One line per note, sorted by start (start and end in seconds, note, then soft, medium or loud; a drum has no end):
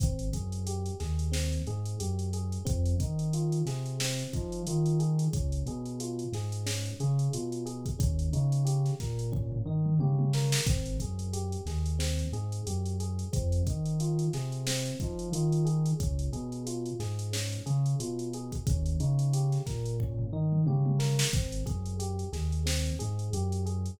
0.00 0.30 G#1 loud
0.00 0.29 C4 loud
0.00 kick loud
0.00 closed hi-hat medium
0.19 closed hi-hat medium
0.33 0.91 F#2 medium
0.33 0.64 G#4 medium
0.33 kick medium
0.33 closed hi-hat medium
0.52 closed hi-hat medium
0.67 0.97 G4 medium
0.67 closed hi-hat medium
0.86 closed hi-hat medium
1.00 1.58 D#2 medium
1.00 1.30 G#4 medium
1.00 snare soft
1.00 closed hi-hat medium
1.19 closed hi-hat medium
1.32 1.62 C4 medium
1.32 snare medium
1.52 closed hi-hat medium
1.67 1.96 G#2 medium
1.67 1.98 G#4 medium
1.67 closed hi-hat medium
1.86 closed hi-hat medium
1.99 2.59 F#2 medium
1.99 2.30 G4 medium
1.99 closed hi-hat medium
2.19 closed hi-hat medium
2.33 2.64 G#4 medium
2.33 closed hi-hat medium
2.52 closed hi-hat medium
2.65 2.96 F2 loud
2.65 2.96 C4 loud
2.65 kick medium
2.65 closed hi-hat medium
2.86 closed hi-hat medium
3.00 3.59 D#3 medium
3.00 3.30 D#4 medium
3.00 kick medium
3.00 closed hi-hat medium
3.19 closed hi-hat medium
3.33 3.64 F4 medium
3.33 closed hi-hat medium
3.52 closed hi-hat medium
3.65 4.23 C3 medium
3.65 3.97 G#4 medium
3.65 snare soft
3.65 closed hi-hat medium
3.86 closed hi-hat medium
4.00 4.31 C4 loud
4.00 snare loud
4.19 snare soft
4.19 closed hi-hat medium
4.33 4.62 F3 medium
4.33 4.65 D#4 medium
4.33 kick medium
4.33 closed hi-hat medium
4.52 closed hi-hat medium
4.67 5.25 D#3 medium
4.67 4.99 F4 medium
4.67 closed hi-hat medium
4.86 closed hi-hat medium
4.99 5.30 G#4 medium
4.99 closed hi-hat medium
5.19 closed hi-hat medium
5.33 5.63 C#2 loud
5.33 5.64 C#4 loud
5.33 kick medium
5.33 closed hi-hat medium
5.52 closed hi-hat medium
5.66 6.24 B2 medium
5.66 5.98 G#4 medium
5.66 closed hi-hat medium
5.86 closed hi-hat medium
6.00 6.31 F4 medium
6.00 closed hi-hat medium
6.19 closed hi-hat medium
6.32 6.90 G#2 medium
6.32 6.65 G#4 medium
6.32 snare soft
6.32 closed hi-hat medium
6.52 closed hi-hat medium
6.66 6.97 C#4 medium
6.66 snare medium
6.86 closed hi-hat medium
7.00 7.29 C#3 medium
7.00 7.31 G#4 medium
7.00 closed hi-hat medium
7.19 closed hi-hat medium
7.33 7.92 B2 medium
7.33 7.64 F4 medium
7.33 closed hi-hat medium
7.52 closed hi-hat medium
7.66 7.96 G#4 medium
7.66 closed hi-hat medium
7.86 kick medium
7.86 closed hi-hat medium
7.99 8.29 D#2 loud
7.99 8.29 C#4 loud
7.99 kick loud
7.99 closed hi-hat medium
8.19 closed hi-hat medium
8.33 8.91 C#3 medium
8.33 8.63 D#4 medium
8.33 closed hi-hat medium
8.52 closed hi-hat medium
8.65 8.95 G4 medium
8.65 closed hi-hat medium
8.86 snare soft
8.86 closed hi-hat medium
9.00 9.58 A#2 medium
9.00 9.30 A#4 medium
9.00 kick medium
9.00 snare soft
9.00 closed hi-hat medium
9.19 closed hi-hat medium
9.32 9.62 C#4 medium
9.32 kick medium
9.32 floor tom medium
9.52 floor tom medium
9.65 9.94 D#3 medium
9.65 9.98 D#4 medium
9.86 mid tom medium
9.99 10.57 C#3 medium
9.99 10.31 G4 medium
9.99 high tom medium
10.19 high tom medium
10.33 10.65 A#4 medium
10.33 snare medium
10.52 snare loud
10.66 10.96 G#1 loud
10.66 10.97 C4 loud
10.66 kick loud
10.66 closed hi-hat medium
10.86 closed hi-hat medium
10.99 11.57 F#2 medium
10.99 11.32 G#4 medium
10.99 kick medium
10.99 closed hi-hat medium
11.19 closed hi-hat medium
11.33 11.64 G4 medium
11.33 closed hi-hat medium
11.52 closed hi-hat medium
11.66 12.24 D#2 medium
11.66 11.98 G#4 medium
11.66 snare soft
11.66 closed hi-hat medium
11.86 closed hi-hat medium
11.99 12.29 C4 medium
11.99 snare medium
12.19 closed hi-hat medium
12.32 12.61 G#2 medium
12.32 12.64 G#4 medium
12.32 closed hi-hat medium
12.52 closed hi-hat medium
12.67 13.25 F#2 medium
12.67 12.97 G4 medium
12.67 closed hi-hat medium
12.86 closed hi-hat medium
13.00 13.31 G#4 medium
13.00 closed hi-hat medium
13.19 closed hi-hat medium
13.33 13.62 F2 loud
13.33 13.63 C4 loud
13.33 kick medium
13.33 closed hi-hat medium
13.52 closed hi-hat medium
13.67 14.26 D#3 medium
13.67 13.98 D#4 medium
13.67 kick medium
13.67 closed hi-hat medium
13.86 closed hi-hat medium
14.00 14.31 F4 medium
14.00 closed hi-hat medium
14.19 closed hi-hat medium
14.33 14.91 C3 medium
14.33 14.64 G#4 medium
14.33 snare soft
14.33 closed hi-hat medium
14.52 closed hi-hat medium
14.67 14.98 C4 loud
14.67 snare loud
14.86 snare soft
14.86 closed hi-hat medium
15.00 15.29 F3 medium
15.00 15.31 D#4 medium
15.00 kick medium
15.00 closed hi-hat medium
15.19 closed hi-hat medium
15.32 15.90 D#3 medium
15.32 15.65 F4 medium
15.32 closed hi-hat medium
15.52 closed hi-hat medium
15.65 15.96 G#4 medium
15.65 closed hi-hat medium
15.86 closed hi-hat medium
16.00 16.29 C#2 loud
16.00 16.30 C#4 loud
16.00 kick medium
16.00 closed hi-hat medium
16.19 closed hi-hat medium
16.33 16.91 B2 medium
16.33 16.63 G#4 medium
16.33 closed hi-hat medium
16.52 closed hi-hat medium
16.67 16.97 F4 medium
16.67 closed hi-hat medium
16.86 closed hi-hat medium
16.99 17.58 G#2 medium
16.99 17.30 G#4 medium
16.99 snare soft
16.99 closed hi-hat medium
17.19 closed hi-hat medium
17.33 17.63 C#4 medium
17.33 snare medium
17.52 closed hi-hat medium
17.66 17.95 C#3 medium
17.66 17.96 G#4 medium
17.66 closed hi-hat medium
17.86 closed hi-hat medium
18.00 18.58 B2 medium
18.00 18.30 F4 medium
18.00 closed hi-hat medium
18.19 closed hi-hat medium
18.33 18.65 G#4 medium
18.33 closed hi-hat medium
18.52 kick medium
18.52 closed hi-hat medium
18.67 18.96 D#2 loud
18.67 18.98 C#4 loud
18.67 kick loud
18.67 closed hi-hat medium
18.86 closed hi-hat medium
19.00 19.58 C#3 medium
19.00 19.31 D#4 medium
19.00 closed hi-hat medium
19.19 closed hi-hat medium
19.33 19.64 G4 medium
19.33 closed hi-hat medium
19.52 snare soft
19.52 closed hi-hat medium
19.66 20.25 A#2 medium
19.66 19.97 A#4 medium
19.66 kick medium
19.66 snare soft
19.66 closed hi-hat medium
19.86 closed hi-hat medium
20.00 20.32 C#4 medium
20.00 kick medium
20.00 floor tom medium
20.19 floor tom medium
20.32 20.61 D#3 medium
20.32 20.64 D#4 medium
20.52 mid tom medium
20.66 21.24 C#3 medium
20.66 20.98 G4 medium
20.66 high tom medium
20.86 high tom medium
20.99 21.30 A#4 medium
20.99 snare medium
21.19 snare loud
21.33 21.63 G#1 loud
21.33 21.64 C4 loud
21.33 kick medium
21.33 closed hi-hat medium
21.52 closed hi-hat medium
21.66 22.24 F#2 medium
21.66 21.96 G#4 loud
21.66 kick medium
21.66 closed hi-hat medium
21.86 closed hi-hat medium
21.99 22.30 G4 medium
21.99 closed hi-hat medium
22.19 closed hi-hat medium
22.33 22.91 D#2 medium
22.33 22.63 G#4 medium
22.33 snare soft
22.33 closed hi-hat medium
22.52 closed hi-hat medium
22.66 22.96 C4 medium
22.66 snare medium
22.86 closed hi-hat medium
22.99 23.30 G#2 loud
22.99 23.30 G#4 medium
22.99 closed hi-hat medium
23.19 closed hi-hat medium
23.33 23.91 F#2 medium
23.33 23.64 G4 medium
23.33 closed hi-hat medium
23.52 closed hi-hat medium
23.66 23.96 G#4 medium
23.66 closed hi-hat medium
23.86 closed hi-hat medium